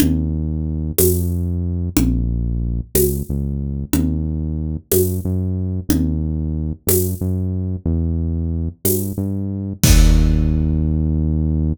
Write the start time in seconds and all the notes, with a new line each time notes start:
0.00 D#2, low conga
0.98 F2, tambourine, high conga
1.97 A#1, low conga
2.95 C#2, tambourine, high conga
3.29 C#2
3.93 D#2, low conga
4.92 F#2, tambourine, high conga
5.25 F#2
5.89 D#2, low conga
6.87 F#2, tambourine, high conga
7.21 F#2
7.86 E2
8.85 G2, tambourine, high conga
9.18 G2
9.83 D#2, kick, crash